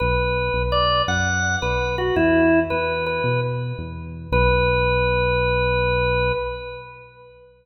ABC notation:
X:1
M:12/8
L:1/8
Q:3/8=111
K:Bm
V:1 name="Drawbar Organ"
B4 d2 f3 B2 F | E3 B2 B2 z5 | B12 |]
V:2 name="Synth Bass 1" clef=bass
B,,,3 B,,,3 F,,3 B,,,3 | E,,3 E,,3 B,,3 E,,3 | B,,,12 |]